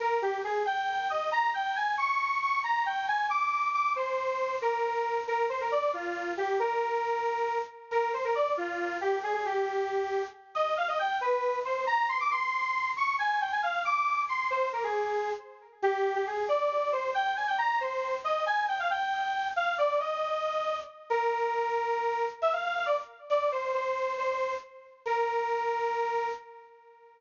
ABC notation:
X:1
M:6/8
L:1/16
Q:3/8=91
K:Eb
V:1 name="Lead 1 (square)"
B2 G2 A2 g4 e2 | b2 g2 a2 _d'4 d'2 | b2 g2 a2 d'4 d'2 | c6 B6 |
B2 c B d2 F4 G2 | B10 z2 | B2 c B d2 F4 G2 | A A G8 z2 |
e2 f e g2 =B4 c2 | b2 c' d' c'6 _d'2 | a2 g a f2 d'4 c'2 | c2 B A5 z4 |
G3 G A2 d4 c2 | g2 a g b2 c4 e2 | a2 g f g6 f2 | d2 e8 z2 |
[K:Bb] B12 | =e f f f d z3 d2 c2 | c4 c4 z4 | B12 |]